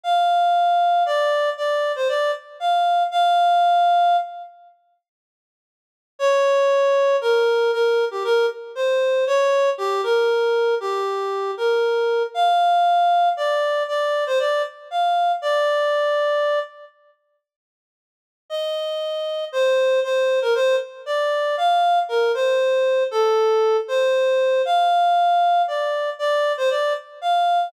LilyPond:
\new Staff { \time 12/8 \key bes \major \tempo 4. = 78 f''2 d''4 d''8. c''16 d''8 r8 f''4 | f''2~ f''8 r2. r8 | des''2 bes'4 bes'8. g'16 bes'8 r8 c''4 | des''4 g'8 bes'4. g'4. bes'4. |
f''2 d''4 d''8. c''16 d''8 r8 f''4 | d''2~ d''8 r2. r8 | ees''2 c''4 c''8. bes'16 c''8 r8 d''4 | f''4 bes'8 c''4. a'4. c''4. |
f''2 d''4 d''8. c''16 d''8 r8 f''4 | }